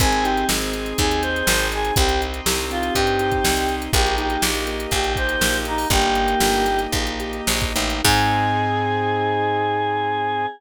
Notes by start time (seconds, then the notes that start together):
0.00 G#1 C4 D#4 G#4, kick, closed hi-hat
0.12 closed hi-hat
0.22 D#4 G4, closed hi-hat
0.37 closed hi-hat
0.49 G#1 G#4, snare
0.61 closed hi-hat
0.73 C4, closed hi-hat
0.86 closed hi-hat
0.98 D#2 D#4 G#4, kick, closed hi-hat
1.11 closed hi-hat
1.22 G#4 C5, closed hi-hat
1.36 closed hi-hat
1.47 G#1 C4, snare
1.59 closed hi-hat
1.72 D#4 G#4, closed hi-hat
1.85 closed hi-hat
1.96 C2 C4 D#4 G4, kick, closed hi-hat
2.09 closed hi-hat
2.21 D#4, closed hi-hat
2.34 closed hi-hat
2.46 C2 G4, snare
2.58 closed hi-hat
2.70 C4 F4, closed hi-hat
2.83 closed hi-hat
2.95 G2 D#4 G4, kick, closed hi-hat
3.07 closed hi-hat
3.19 G4, closed hi-hat
3.32 kick, closed hi-hat
3.44 C2 C4, snare
3.57 closed hi-hat
3.69 D#4, closed hi-hat
3.82 closed hi-hat
3.93 A#1 A#3 D#4 G4, kick, closed hi-hat
4.06 closed hi-hat
4.18 D#4 G4, closed hi-hat
4.30 closed hi-hat
4.42 A#1 G4, snare
4.55 closed hi-hat
4.67 A#3, closed hi-hat
4.80 closed hi-hat
4.91 A#1 D#4 G4, kick, closed hi-hat
5.04 closed hi-hat
5.16 G4 C5, kick, closed hi-hat
5.29 closed hi-hat
5.41 A#1 A#3, snare
5.53 closed hi-hat
5.65 D#4, closed hi-hat
5.78 open hi-hat
5.90 G1 A#3 D#4 G4, kick, closed hi-hat
6.01 closed hi-hat
6.15 D#4, closed hi-hat
6.28 closed hi-hat
6.40 G1 G4, snare
6.53 closed hi-hat
6.66 A#3, closed hi-hat
6.79 closed hi-hat
6.92 A#1 D#4, kick, closed hi-hat
7.07 closed hi-hat
7.20 G4, closed hi-hat
7.33 closed hi-hat
7.47 A#1 A#3, snare
7.61 kick, closed hi-hat
7.76 A1 D#4, closed hi-hat
7.90 closed hi-hat
8.04 G#2 C4 D#4 G#4, kick, crash